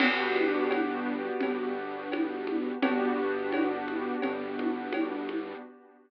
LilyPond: <<
  \new Staff \with { instrumentName = "Acoustic Grand Piano" } { \time 4/4 \key g \major \tempo 4 = 85 <b d' fis' g'>1 | <b d' fis' g'>1 | }
  \new Staff \with { instrumentName = "Synth Bass 1" } { \clef bass \time 4/4 \key g \major g,,2 g,,2 | g,,2 g,,2 | }
  \new DrumStaff \with { instrumentName = "Drums" } \drummode { \time 4/4 <cgl cb cymc>8 cgho8 <cgho cb>4 <cgl cb>4 <cgho cb>8 cgho8 | <cgl cb>4 <cgho cb>8 cgho8 <cgl cb>8 cgho8 <cgho cb>8 cgho8 | }
>>